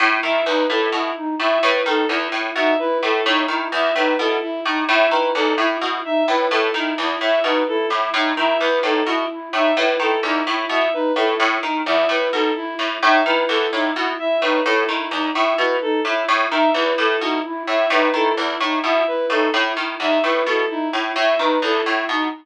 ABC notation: X:1
M:6/4
L:1/8
Q:1/4=129
K:none
V:1 name="Harpsichord" clef=bass
A,, ^D, E,, A,, B,, z A,, A,, D, E,, A,, B,, | z A,, A,, ^D, E,, A,, B,, z A,, A,, D, E,, | A,, B,, z A,, A,, ^D, E,, A,, B,, z A,, A,, | ^D, E,, A,, B,, z A,, A,, D, E,, A,, B,, z |
A,, A,, ^D, E,, A,, B,, z A,, A,, D, E,, A,, | B,, z A,, A,, ^D, E,, A,, B,, z A,, A,, D, | E,, A,, B,, z A,, A,, ^D, E,, A,, B,, z A,, | A,, ^D, E,, A,, B,, z A,, A,, D, E,, A,, B,, |]
V:2 name="Flute"
E E ^D E E D E E D E E D | E E ^D E E D E E D E E D | E E ^D E E D E E D E E D | E E ^D E E D E E D E E D |
E E ^D E E D E E D E E D | E E ^D E E D E E D E E D | E E ^D E E D E E D E E D | E E ^D E E D E E D E E D |]
V:3 name="Violin"
z e B A E z e B A E z e | B A E z e B A E z e B A | E z e B A E z e B A E z | e B A E z e B A E z e B |
A E z e B A E z e B A E | z e B A E z e B A E z e | B A E z e B A E z e B A | E z e B A E z e B A E z |]